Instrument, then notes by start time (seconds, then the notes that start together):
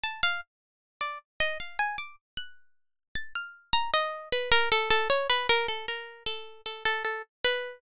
harpsichord
0.04 A5
0.23 F5
1.01 D5
1.40 D#5
1.60 F5
1.79 G#5
1.98 D6
2.37 F#6
3.15 A6
3.35 F6
3.73 A#5
3.94 D#5
4.32 B4
4.52 A#4
4.72 A4
4.90 A4
5.10 C#5
5.30 B4
5.49 A#4
5.68 A4
5.88 A#4
6.26 A4
6.66 A4
6.85 A4
7.05 A4
7.44 B4